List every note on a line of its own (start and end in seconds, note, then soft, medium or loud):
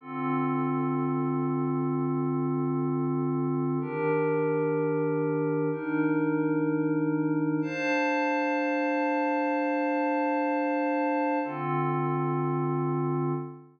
0.01 3.78 D3 medium
0.01 3.78 C4 medium
0.01 3.78 F4 medium
0.01 3.78 A4 medium
3.81 5.69 D#3 medium
3.81 5.69 D4 medium
3.81 5.69 G4 medium
3.81 5.69 A#4 medium
5.71 7.60 D#3 medium
5.71 7.60 D4 medium
5.71 7.60 D#4 medium
5.71 7.60 A#4 medium
7.62 11.39 D4 medium
7.62 11.39 C5 medium
7.62 11.39 F5 medium
7.62 11.39 A5 medium
11.44 13.33 D3 medium
11.44 13.33 C4 medium
11.44 13.33 F4 medium
11.44 13.33 A4 medium